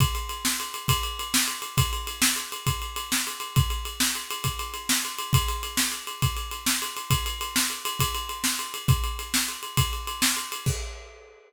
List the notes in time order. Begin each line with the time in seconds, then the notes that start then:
0.00 kick, ride
0.15 ride
0.29 ride
0.45 snare
0.60 ride
0.74 ride
0.88 kick, ride
1.03 ride
1.19 ride
1.34 snare
1.48 ride
1.62 ride
1.77 kick, ride
1.93 ride
2.07 ride
2.22 snare
2.36 ride
2.52 ride
2.67 kick, ride
2.82 ride
2.96 ride
3.12 snare
3.27 ride
3.40 ride
3.56 kick, ride
3.70 ride
3.85 ride
4.00 snare
4.15 ride
4.31 ride
4.44 kick, ride
4.59 ride
4.74 ride
4.89 snare
5.05 ride
5.19 ride
5.33 kick, ride
5.48 ride
5.63 ride
5.77 snare
5.92 ride
6.07 ride
6.22 kick, ride
6.37 ride
6.51 ride
6.66 snare
6.82 ride
6.97 ride
7.10 kick, ride
7.26 ride
7.41 ride
7.56 snare
7.70 ride
7.85 ride
7.99 kick, ride
8.15 ride
8.29 ride
8.44 snare
8.59 ride
8.74 ride
8.88 kick, ride
9.04 ride
9.19 ride
9.34 snare
9.48 ride
9.63 ride
9.77 kick, ride
9.93 ride
10.07 ride
10.22 snare
10.37 ride
10.52 ride
10.66 kick, crash